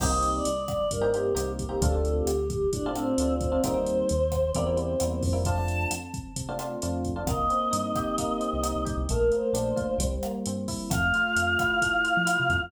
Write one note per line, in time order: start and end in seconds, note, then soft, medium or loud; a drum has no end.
0.00 0.41 C2 medium
0.00 0.10 A#3 medium
0.00 0.10 C4 medium
0.00 0.10 D#4 medium
0.00 0.10 G4 medium
0.00 0.30 D#5 medium
0.00 kick medium
0.00 cross-stick medium
0.00 crash medium
0.11 0.47 A#3 medium
0.11 0.47 C4 medium
0.11 0.47 D#4 medium
0.11 0.47 G4 medium
0.23 closed hi-hat medium
0.34 0.65 D5 medium
0.45 0.87 C2 medium
0.45 closed hi-hat medium
0.68 0.89 D5 medium
0.68 kick medium
0.68 cross-stick medium
0.68 closed hi-hat medium
0.91 1.32 G2 medium
0.91 1.09 A#4 medium
0.91 kick medium
0.91 closed hi-hat medium
1.01 1.11 A#3 medium
1.01 1.11 C4 medium
1.01 1.11 D#4 medium
1.01 1.11 G4 medium
1.12 1.32 A#3 medium
1.12 1.32 C4 medium
1.12 1.32 D#4 medium
1.12 1.52 G4 medium
1.12 1.32 G4 medium
1.12 closed hi-hat medium
1.35 1.77 C2 medium
1.35 1.62 A#3 medium
1.35 1.62 C4 medium
1.35 1.62 D#4 medium
1.35 1.62 G4 medium
1.35 cross-stick medium
1.35 closed hi-hat medium
1.59 1.82 G4 medium
1.59 kick medium
1.59 closed hi-hat medium
1.69 1.78 A#3 medium
1.69 1.78 C4 medium
1.69 1.78 D#4 medium
1.69 1.78 G4 medium
1.81 2.22 D2 loud
1.81 1.91 A3 medium
1.81 1.91 C4 medium
1.81 1.91 D4 medium
1.81 1.91 F4 medium
1.81 2.11 A4 loud
1.81 kick medium
1.81 closed hi-hat medium
1.92 2.29 A3 medium
1.92 2.29 C4 medium
1.92 2.29 D4 medium
1.92 2.29 F4 medium
2.05 closed hi-hat medium
2.17 2.48 G4 medium
2.26 2.67 D2 medium
2.26 cross-stick medium
2.26 closed hi-hat medium
2.50 2.70 G4 medium
2.50 kick medium
2.50 closed hi-hat medium
2.72 3.14 A2 medium
2.72 2.92 D4 medium
2.72 kick medium
2.72 closed hi-hat medium
2.86 2.95 A3 medium
2.86 2.95 C4 medium
2.86 2.95 D4 medium
2.86 2.95 F4 medium
2.94 3.14 A3 medium
2.94 3.34 C4 medium
2.94 3.14 C4 medium
2.94 3.14 D4 medium
2.94 3.14 F4 medium
2.94 cross-stick medium
2.94 closed hi-hat medium
3.18 3.59 D2 medium
3.18 3.47 A3 medium
3.18 3.47 C4 medium
3.18 3.47 D4 medium
3.18 3.47 F4 medium
3.18 closed hi-hat medium
3.41 3.60 C4 medium
3.41 kick medium
3.41 closed hi-hat medium
3.52 3.61 A3 medium
3.52 3.61 C4 medium
3.52 3.61 D4 medium
3.52 3.61 F4 medium
3.63 4.04 D#2 medium
3.63 3.73 G3 medium
3.63 3.73 A#3 medium
3.63 3.73 C4 medium
3.63 3.73 D#4 medium
3.63 4.51 C5 loud
3.63 kick medium
3.63 cross-stick medium
3.63 closed hi-hat medium
3.74 4.10 G3 medium
3.74 4.10 A#3 medium
3.74 4.10 C4 medium
3.74 4.10 D#4 medium
3.86 closed hi-hat medium
4.09 4.52 D#2 medium
4.09 closed hi-hat medium
4.32 kick medium
4.32 cross-stick medium
4.32 closed hi-hat medium
4.53 4.96 E2 medium
4.53 4.65 G3 medium
4.53 4.65 A#3 medium
4.53 4.65 C4 medium
4.53 4.65 E4 medium
4.53 4.64 D5 medium
4.53 kick medium
4.53 closed hi-hat medium
4.66 4.76 G3 medium
4.66 4.76 A#3 medium
4.66 4.76 C4 medium
4.66 4.76 E4 medium
4.66 4.77 C5 medium
4.77 4.95 G3 medium
4.77 4.95 A#3 medium
4.77 4.95 C4 medium
4.77 4.95 E4 medium
4.77 5.06 C5 medium
4.77 closed hi-hat medium
5.00 5.23 E2 medium
5.00 5.28 G3 medium
5.00 5.28 A#3 medium
5.00 5.28 C4 medium
5.00 5.28 E4 medium
5.00 cross-stick medium
5.00 closed hi-hat medium
5.11 5.21 C5 medium
5.23 5.86 F2 loud
5.23 kick medium
5.23 open hi-hat medium
5.33 5.42 G3 medium
5.33 5.42 A#3 medium
5.33 5.42 C4 medium
5.33 5.42 E4 medium
5.45 5.55 A3 medium
5.45 5.55 C4 medium
5.45 5.55 D4 medium
5.45 5.55 F4 medium
5.45 5.84 A5 medium
5.45 kick medium
5.45 closed hi-hat medium
5.57 5.93 A3 medium
5.57 5.93 C4 medium
5.57 5.93 D4 medium
5.57 5.93 F4 medium
5.68 closed hi-hat medium
5.91 6.32 F2 medium
5.91 cross-stick medium
5.91 closed hi-hat loud
6.14 kick medium
6.14 closed hi-hat medium
6.36 6.77 C3 medium
6.36 kick medium
6.36 closed hi-hat medium
6.49 6.58 A3 medium
6.49 6.58 C4 medium
6.49 6.58 D4 medium
6.49 6.58 F4 medium
6.59 6.77 A3 medium
6.59 6.77 C4 medium
6.59 6.77 D4 medium
6.59 6.77 F4 medium
6.59 cross-stick medium
6.59 closed hi-hat medium
6.82 7.24 F2 medium
6.82 7.10 A3 medium
6.82 7.10 C4 medium
6.82 7.10 D4 medium
6.82 7.10 F4 medium
6.82 closed hi-hat medium
7.04 kick medium
7.04 closed hi-hat medium
7.16 7.25 A3 medium
7.16 7.25 C4 medium
7.16 7.25 D4 medium
7.16 7.25 F4 medium
7.26 7.47 C2 medium
7.26 8.18 A#3 loud
7.26 8.80 D#5 medium
7.26 kick medium
7.26 cross-stick medium
7.26 closed hi-hat medium
7.50 8.39 C4 medium
7.50 closed hi-hat medium
7.71 7.93 G2 medium
7.71 8.62 D#4 medium
7.71 closed hi-hat medium
7.95 8.85 G4 medium
7.95 kick medium
7.95 cross-stick medium
7.95 closed hi-hat medium
8.18 9.04 A#3 loud
8.18 kick medium
8.18 closed hi-hat medium
8.40 9.05 C4 medium
8.40 closed hi-hat medium
8.53 8.74 C2 medium
8.63 9.06 D#4 medium
8.63 cross-stick medium
8.63 closed hi-hat medium
8.76 8.86 C2 medium
8.85 8.96 C2 medium
8.85 9.07 G4 medium
8.85 kick medium
8.85 closed hi-hat medium
8.97 9.07 C2 medium
9.09 9.31 A#1 medium
9.09 9.97 A3 loud
9.09 9.30 A#4 loud
9.09 kick medium
9.09 closed hi-hat medium
9.32 9.97 A#3 medium
9.32 9.99 C5 medium
9.32 closed hi-hat medium
9.53 9.74 A#1 medium
9.53 9.97 D4 medium
9.53 cross-stick medium
9.53 closed hi-hat medium
9.76 9.98 F4 medium
9.76 kick medium
9.76 closed hi-hat medium
9.98 10.19 C2 medium
9.98 10.85 G3 medium
9.98 kick medium
9.98 closed hi-hat loud
10.23 10.89 A#3 medium
10.23 cross-stick medium
10.23 closed hi-hat medium
10.46 10.67 G2 medium
10.46 10.90 C4 medium
10.46 closed hi-hat medium
10.68 10.90 E4 medium
10.68 kick medium
10.68 open hi-hat medium
10.90 11.12 F2 medium
10.90 11.36 A3 loud
10.90 12.59 F5 medium
10.90 kick medium
10.90 cross-stick medium
10.90 closed hi-hat medium
11.14 12.04 F4 medium
11.14 closed hi-hat medium
11.36 11.57 F2 medium
11.36 11.81 A3 medium
11.36 closed hi-hat medium
11.59 12.26 E4 medium
11.59 kick medium
11.59 cross-stick medium
11.59 closed hi-hat medium
11.82 12.49 A3 medium
11.82 kick medium
11.82 closed hi-hat medium
12.04 12.69 F4 medium
12.04 closed hi-hat medium
12.17 12.37 F3 medium
12.26 12.69 E4 loud
12.26 cross-stick medium
12.26 closed hi-hat loud
12.40 12.50 C3 medium
12.49 12.60 F2 medium
12.49 12.71 A3 medium
12.49 kick medium
12.49 closed hi-hat medium
12.62 12.72 F2 medium